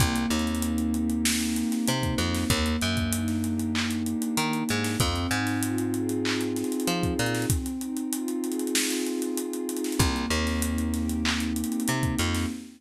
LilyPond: <<
  \new Staff \with { instrumentName = "Pad 2 (warm)" } { \time 4/4 \key c \minor \tempo 4 = 96 bes8 c'8 ees'8 g'8 ees'8 c'8 bes8 c'8 | bes8 d'8 ees'8 g'8 ees'8 d'8 bes8 d'8 | c'8 ees'8 f'8 aes'8 f'8 ees'8 c'8 ees'8 | c'8 ees'8 f'8 aes'8 f'8 ees'8 c'8 ees'8 |
bes8 c'8 ees'8 g'8 ees'8 c'8 bes8 c'8 | }
  \new Staff \with { instrumentName = "Electric Bass (finger)" } { \clef bass \time 4/4 \key c \minor c,8 ees,2~ ees,8 c8 f,8 | ees,8 ges,2~ ges,8 ees8 aes,8 | f,8 aes,2~ aes,8 f8 bes,8 | r1 |
c,8 ees,2~ ees,8 c8 f,8 | }
  \new DrumStaff \with { instrumentName = "Drums" } \drummode { \time 4/4 <hh bd>16 hh16 hh32 hh32 hh32 hh32 hh16 hh16 hh16 hh16 sn16 hh16 hh16 <hh sn>16 hh16 <hh bd>16 hh16 <hh sn>16 | <hh bd>16 hh16 hh16 <hh bd>16 hh16 <hh sn>16 hh16 hh16 hc16 hh16 hh16 hh16 hh16 hh16 hh16 <hh sn>16 | <hh bd>16 hh16 hh16 <hh sn>16 hh16 hh16 hh16 hh16 hc16 hh16 <hh sn>32 hh32 hh32 hh32 hh16 <hh bd>16 hh32 hh32 <hh sn>32 hh32 | <hh bd>16 hh16 hh16 hh16 hh16 hh16 hh32 hh32 hh32 hh32 sn16 hh16 hh16 hh16 hh16 hh16 hh32 hh32 <hh sn>32 hh32 |
<hh bd>16 hh16 hh16 <hh sn>16 hh16 hh16 <hh sn>16 hh16 hc16 hh16 hh32 hh32 hh32 hh32 hh16 <hh bd>16 hh16 <hh sn>16 | }
>>